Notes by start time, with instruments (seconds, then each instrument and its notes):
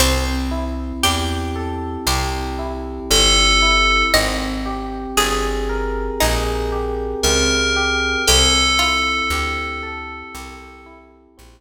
0.00 electric bass (finger) C2, pizzicato strings C4, electric piano 1 C4
0.51 electric piano 1 E4
1.03 electric bass (finger) E2, electric piano 1 G4, pizzicato strings G4
1.56 electric piano 1 A4
2.07 electric bass (finger) C2, electric piano 1 G4, pizzicato strings C5
2.59 electric piano 1 E4
3.10 electric bass (finger) G1, electric piano 1 C4, tubular bells A4
3.62 electric piano 1 E4
4.14 electric bass (finger) G#1, electric piano 1 C4, pizzicato strings D#5
4.66 electric piano 1 G4
5.17 electric bass (finger) G1, electric piano 1 G#4, pizzicato strings G#4
5.69 electric piano 1 A#4
6.20 electric bass (finger) A#1, pizzicato strings D#4, electric piano 1 G#4
6.72 electric piano 1 G4
7.23 electric bass (finger) C#2, electric piano 1 C4, tubular bells A#4
7.76 electric piano 1 G4
8.27 electric bass (finger) C2, electric piano 1 C4, pizzicato strings G4, tubular bells A4
8.79 electric piano 1 E4, pizzicato strings F4
9.30 electric bass (finger) D2, electric piano 1 G4
9.83 electric piano 1 A4
10.34 electric bass (finger) C2, electric piano 1 G4
10.86 electric piano 1 E4
11.38 electric bass (finger) A#1, electric piano 1 C4